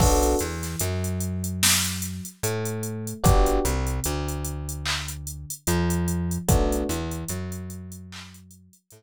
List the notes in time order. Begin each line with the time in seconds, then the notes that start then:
0.00 B1 B3 D4 F#4 A4, kick, crash
0.23 closed hi-hat
0.39 E2 E3, closed hi-hat
0.63 snare, closed hi-hat
0.80 F#2 F#3, closed hi-hat
1.04 closed hi-hat
1.20 closed hi-hat
1.44 closed hi-hat
1.63 snare
1.84 closed hi-hat
2.02 closed hi-hat
2.25 closed hi-hat
2.43 A2 A3, closed hi-hat
2.65 closed hi-hat
2.83 closed hi-hat
3.07 closed hi-hat
3.23 G1 B3 D4 F#4 G4, kick, closed hi-hat
3.46 closed hi-hat
3.65 C2 C3, closed hi-hat
3.87 closed hi-hat
4.04 D2 D3, closed hi-hat
4.28 closed hi-hat
4.45 closed hi-hat
4.69 closed hi-hat
4.85 clap
5.08 closed hi-hat
5.27 closed hi-hat
5.50 closed hi-hat
5.67 F2 F3, closed hi-hat
5.90 closed hi-hat
6.08 closed hi-hat
6.31 closed hi-hat
6.48 B1 A3 B3 D4 F#4, kick, closed hi-hat
6.72 closed hi-hat
6.89 E2 E3, closed hi-hat
7.11 closed hi-hat
7.29 F#2 F#3, closed hi-hat
7.52 closed hi-hat
7.70 closed hi-hat
7.92 closed hi-hat
8.12 clap
8.34 closed hi-hat
8.51 closed hi-hat
8.73 closed hi-hat
8.91 A2 A3, closed hi-hat